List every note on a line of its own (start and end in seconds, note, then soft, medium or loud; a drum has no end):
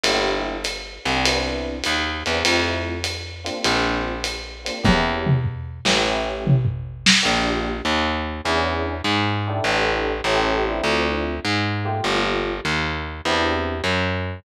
0.04 0.99 G1 medium
0.04 0.54 A#3 medium
0.04 0.54 D4 medium
0.04 0.54 E4 medium
0.04 0.54 G4 medium
0.04 ride medium
0.64 hi-hat pedal medium
0.64 ride medium
1.05 1.82 C2 medium
1.05 1.20 A#3 medium
1.05 1.20 D4 medium
1.05 1.20 E4 medium
1.05 1.20 G4 medium
1.05 ride medium
1.26 1.75 B3 medium
1.26 1.75 C4 medium
1.26 1.75 D4 medium
1.26 1.75 E4 medium
1.26 ride medium
1.84 2.23 D#2 medium
1.84 hi-hat pedal medium
1.84 ride medium
2.26 2.43 E2 medium
2.26 2.40 B3 medium
2.26 2.40 C4 medium
2.26 2.40 D4 medium
2.26 2.40 E4 medium
2.26 ride medium
2.44 3.50 F2 medium
2.44 2.93 A3 medium
2.44 2.93 C4 medium
2.44 2.93 E4 medium
2.44 2.93 F4 medium
2.44 ride medium
3.04 hi-hat pedal medium
3.04 ride medium
3.44 4.12 A#3 medium
3.44 4.12 C4 medium
3.44 4.12 D4 medium
3.44 4.12 F4 medium
3.44 ride medium
3.65 4.70 A#1 medium
3.65 ride medium
4.24 hi-hat pedal medium
4.24 ride medium
4.64 4.77 A#3 medium
4.64 4.77 C4 medium
4.64 4.77 D4 medium
4.64 4.77 F4 medium
4.64 ride medium
4.83 5.80 E2 medium
4.83 5.32 A#3 medium
4.83 5.32 C#4 medium
4.83 5.32 E4 medium
4.83 5.32 G4 medium
4.83 kick medium
4.83 high tom medium
5.27 mid tom medium
5.44 floor tom medium
5.85 7.09 A1 medium
5.85 5.99 A#3 medium
5.85 5.99 C#4 medium
5.85 5.99 E4 medium
5.85 5.99 G4 medium
5.85 snare medium
6.05 6.54 A3 medium
6.05 6.54 C#4 medium
6.05 6.54 E4 medium
6.05 6.54 G4 medium
6.47 mid tom medium
6.65 floor tom medium
7.06 snare medium
7.22 7.82 A#1 medium
7.22 7.71 A#3 medium
7.22 7.71 D4 medium
7.22 7.71 F4 medium
7.22 7.71 G4 medium
7.85 8.41 D#2 medium
8.44 9.02 E2 loud
8.44 8.93 C#4 medium
8.44 8.93 D4 medium
8.44 8.93 E4 medium
8.44 8.93 G#4 medium
9.04 9.61 G#2 medium
9.47 10.14 D4 medium
9.47 10.14 E4 medium
9.47 10.14 G4 medium
9.47 10.14 A4 medium
9.64 10.21 A1 loud
10.24 10.81 A1 loud
10.24 10.64 C#4 medium
10.24 10.64 E4 medium
10.24 10.64 G4 medium
10.24 10.64 A4 medium
10.66 11.33 C4 medium
10.66 11.33 D4 medium
10.66 11.33 E4 medium
10.66 11.33 F4 medium
10.84 11.40 D2 loud
11.45 12.01 G#2 medium
11.85 12.52 A3 medium
11.85 12.52 A#3 medium
11.85 12.52 F4 medium
11.85 12.52 G4 medium
12.04 12.60 G1 loud
12.65 13.21 D#2 medium
13.25 13.82 E2 loud
13.25 13.74 C4 medium
13.25 13.74 D4 medium
13.25 13.74 E4 medium
13.25 13.74 G4 medium
13.84 14.40 F#2 medium